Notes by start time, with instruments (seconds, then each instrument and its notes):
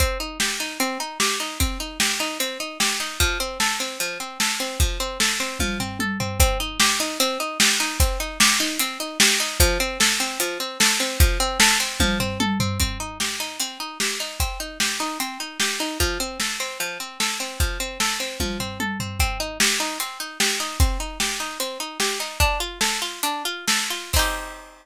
0.00 pizzicato strings C4, kick, closed hi-hat
0.20 pizzicato strings D#4
0.40 pizzicato strings G4, snare
0.60 pizzicato strings D#4
0.80 pizzicato strings C4, closed hi-hat
1.00 pizzicato strings D#4
1.20 pizzicato strings G4, snare
1.40 pizzicato strings D#4
1.60 pizzicato strings C4, kick, closed hi-hat
1.80 pizzicato strings D#4
2.00 pizzicato strings G4, snare
2.20 pizzicato strings D#4
2.40 pizzicato strings C4, closed hi-hat
2.60 pizzicato strings D#4
2.80 pizzicato strings G4, snare
3.00 pizzicato strings D#4
3.20 pizzicato strings F3, kick, closed hi-hat
3.40 pizzicato strings C4
3.60 pizzicato strings A4, snare
3.80 pizzicato strings C4
4.00 pizzicato strings F3, closed hi-hat
4.20 pizzicato strings C4
4.40 pizzicato strings A4, snare
4.60 pizzicato strings C4
4.80 pizzicato strings F3, kick, closed hi-hat
5.00 pizzicato strings C4
5.20 pizzicato strings A4, snare
5.40 pizzicato strings C4
5.60 pizzicato strings F3, kick, high tom
5.80 pizzicato strings C4, floor tom
5.99 pizzicato strings A4, high tom
6.20 pizzicato strings C4, floor tom
6.40 pizzicato strings C4, kick, closed hi-hat
6.60 pizzicato strings D#4
6.80 pizzicato strings G4, snare
7.00 pizzicato strings D#4
7.20 pizzicato strings C4, closed hi-hat
7.40 pizzicato strings D#4
7.60 pizzicato strings G4, snare
7.80 pizzicato strings D#4
8.00 pizzicato strings C4, kick, closed hi-hat
8.20 pizzicato strings D#4
8.40 pizzicato strings G4, snare
8.60 pizzicato strings D#4
8.79 pizzicato strings C4, closed hi-hat
9.00 pizzicato strings D#4
9.20 pizzicato strings G4, snare
9.40 pizzicato strings D#4
9.60 pizzicato strings F3, kick, closed hi-hat
9.80 pizzicato strings C4
10.00 pizzicato strings A4, snare
10.20 pizzicato strings C4
10.40 pizzicato strings F3, closed hi-hat
10.60 pizzicato strings C4
10.80 pizzicato strings A4, snare
11.00 pizzicato strings C4
11.20 pizzicato strings F3, kick, closed hi-hat
11.40 pizzicato strings C4
11.60 pizzicato strings A4, snare
11.80 pizzicato strings C4
12.00 pizzicato strings F3, kick, high tom
12.20 pizzicato strings C4, floor tom
12.40 pizzicato strings A4, high tom
12.60 pizzicato strings C4, floor tom
12.80 pizzicato strings C4, kick, closed hi-hat
13.00 pizzicato strings D#4
13.20 pizzicato strings G4, snare
13.40 pizzicato strings D#4
13.60 pizzicato strings C4, closed hi-hat
13.80 pizzicato strings D#4
14.00 pizzicato strings G4, snare
14.20 pizzicato strings D#4
14.40 pizzicato strings C4, kick, closed hi-hat
14.60 pizzicato strings D#4
14.80 pizzicato strings G4, snare
15.00 pizzicato strings D#4
15.20 pizzicato strings C4, closed hi-hat
15.40 pizzicato strings D#4
15.60 pizzicato strings G4, snare
15.80 pizzicato strings D#4
16.00 pizzicato strings F3, kick, closed hi-hat
16.20 pizzicato strings C4
16.40 pizzicato strings A4, snare
16.60 pizzicato strings C4
16.80 pizzicato strings F3, closed hi-hat
17.00 pizzicato strings C4
17.20 pizzicato strings A4, snare
17.40 pizzicato strings C4
17.60 pizzicato strings F3, kick, closed hi-hat
17.80 pizzicato strings C4
18.00 pizzicato strings A4, snare
18.20 pizzicato strings C4
18.40 pizzicato strings F3, kick, high tom
18.60 pizzicato strings C4, floor tom
18.80 pizzicato strings A4, high tom
19.00 pizzicato strings C4, floor tom
19.20 pizzicato strings C4, kick, closed hi-hat
19.40 pizzicato strings D#4
19.60 pizzicato strings G4, snare
19.80 pizzicato strings D#4
20.00 pizzicato strings C4, closed hi-hat
20.20 pizzicato strings D#4
20.40 pizzicato strings G4, snare
20.60 pizzicato strings D#4
20.80 pizzicato strings C4, kick, closed hi-hat
21.00 pizzicato strings D#4
21.20 pizzicato strings G4, snare
21.40 pizzicato strings D#4
21.60 pizzicato strings C4, closed hi-hat
21.80 pizzicato strings D#4
22.00 pizzicato strings G4, snare
22.20 pizzicato strings D#4
22.40 pizzicato strings D4, kick, closed hi-hat
22.60 pizzicato strings F4
22.81 pizzicato strings A4, snare
23.02 pizzicato strings F4
23.23 pizzicato strings D4, closed hi-hat
23.45 pizzicato strings F4
23.68 pizzicato strings A4, snare
23.90 pizzicato strings F4
24.13 pizzicato strings C4 D#4, kick, crash
24.19 pizzicato strings G4